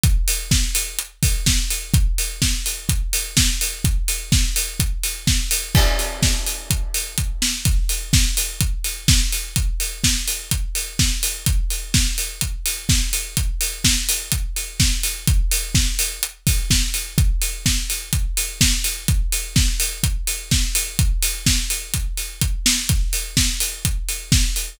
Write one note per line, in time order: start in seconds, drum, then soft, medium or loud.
0.03 kick loud
0.03 closed hi-hat loud
0.28 open hi-hat loud
0.51 kick loud
0.51 snare loud
0.75 open hi-hat loud
0.99 closed hi-hat loud
1.23 kick loud
1.23 open hi-hat medium
1.46 kick medium
1.46 snare loud
1.70 open hi-hat medium
1.94 kick loud
1.94 closed hi-hat loud
2.18 open hi-hat medium
2.42 kick medium
2.42 snare loud
2.66 open hi-hat medium
2.89 kick loud
2.89 closed hi-hat loud
3.13 open hi-hat loud
3.37 kick loud
3.37 snare loud
3.61 open hi-hat medium
3.84 kick loud
3.84 closed hi-hat loud
4.08 open hi-hat medium
4.32 kick loud
4.32 snare loud
4.56 open hi-hat loud
4.80 kick loud
4.80 closed hi-hat loud
5.03 open hi-hat medium
5.27 kick loud
5.27 snare loud
5.51 open hi-hat loud
5.75 kick loud
5.75 crash loud
5.99 open hi-hat medium
6.22 kick loud
6.22 snare loud
6.46 open hi-hat medium
6.70 kick medium
6.70 closed hi-hat loud
6.94 open hi-hat medium
7.18 kick medium
7.18 closed hi-hat loud
7.42 snare loud
7.65 kick loud
7.65 closed hi-hat loud
7.89 open hi-hat medium
8.13 kick loud
8.13 snare loud
8.37 open hi-hat loud
8.61 kick loud
8.61 closed hi-hat loud
8.84 open hi-hat medium
9.08 kick loud
9.08 snare loud
9.32 open hi-hat medium
9.56 kick loud
9.56 closed hi-hat loud
9.80 open hi-hat medium
10.04 kick medium
10.04 snare loud
10.28 open hi-hat medium
10.51 kick medium
10.51 closed hi-hat loud
10.75 open hi-hat medium
10.99 kick loud
10.99 snare loud
11.23 open hi-hat loud
11.46 kick loud
11.46 closed hi-hat loud
11.70 open hi-hat medium
11.94 kick loud
11.94 snare loud
12.18 open hi-hat medium
12.41 kick medium
12.41 closed hi-hat loud
12.66 open hi-hat medium
12.89 kick loud
12.89 snare loud
13.13 open hi-hat medium
13.37 kick loud
13.37 closed hi-hat loud
13.61 open hi-hat medium
13.84 kick medium
13.84 snare loud
14.09 open hi-hat loud
14.32 kick medium
14.32 closed hi-hat loud
14.56 open hi-hat medium
14.80 kick loud
14.80 snare loud
15.03 open hi-hat medium
15.27 kick loud
15.27 closed hi-hat loud
15.51 open hi-hat loud
15.75 kick loud
15.75 snare loud
15.99 open hi-hat loud
16.23 closed hi-hat loud
16.47 kick loud
16.47 open hi-hat medium
16.70 kick medium
16.70 snare loud
16.94 open hi-hat medium
17.18 kick loud
17.18 closed hi-hat loud
17.41 open hi-hat medium
17.66 kick medium
17.66 snare loud
17.90 open hi-hat medium
18.13 kick loud
18.13 closed hi-hat loud
18.37 open hi-hat loud
18.61 kick loud
18.61 snare loud
18.84 open hi-hat medium
19.08 kick loud
19.08 closed hi-hat loud
19.32 open hi-hat medium
19.56 kick loud
19.56 snare loud
19.80 open hi-hat loud
20.03 kick loud
20.03 closed hi-hat loud
20.27 open hi-hat medium
20.51 kick loud
20.51 snare loud
20.75 open hi-hat loud
20.99 kick loud
20.99 closed hi-hat loud
21.22 open hi-hat loud
21.46 kick medium
21.46 snare loud
21.70 open hi-hat medium
21.94 kick loud
21.94 closed hi-hat loud
22.17 open hi-hat medium
22.41 kick loud
22.41 closed hi-hat loud
22.66 snare loud
22.89 kick loud
22.89 closed hi-hat loud
23.13 open hi-hat medium
23.37 kick medium
23.37 snare loud
23.60 open hi-hat medium
23.85 kick medium
23.85 closed hi-hat loud
24.09 open hi-hat medium
24.32 kick loud
24.32 snare loud
24.56 open hi-hat medium